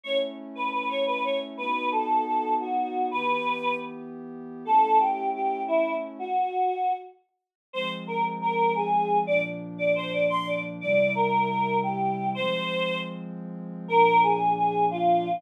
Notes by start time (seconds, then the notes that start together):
0.03 A3 C#4 E4 C#5
0.55 B4
0.72 B4
0.89 C#5
1.06 B4
1.24 C#5
1.57 B3 D#4 F#4 B4
1.92 A4
2.26 A4
2.60 F#4
3.11 E3 B3 G4 B4
4.65 A3 C#4 E4 A4
4.99 G4
5.34 G4
5.68 E4
6.19 F#4
7.73 F3 G#3 C4 C5
8.07 A#4
8.41 A#4
8.76 G#4
9.27 A#2 F3 D4 D5
9.78 D5
9.95 C5
10.12 D5
10.29 C6
10.47 D5
10.81 C3 G3 E4 D5
11.15 A#4
11.49 A#4
11.83 G4
12.35 F3 G#3 C4 C5
13.88 A#2 F3 D4 A#4
14.23 G#4
14.57 G#4
14.91 F4